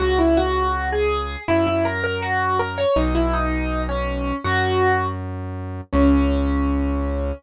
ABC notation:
X:1
M:2/4
L:1/16
Q:1/4=81
K:C#dor
V:1 name="Acoustic Grand Piano"
F E F3 G3 | E E A A F2 A c | D E D3 C3 | F4 z4 |
C8 |]
V:2 name="Synth Bass 1" clef=bass
C,,8 | F,,8 | B,,,8 | F,,8 |
C,,8 |]